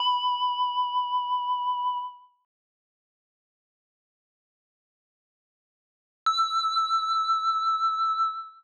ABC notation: X:1
M:4/4
L:1/8
Q:1/4=115
K:Edor
V:1 name="Tubular Bells"
b8 | z8 | z8 | e'8 |]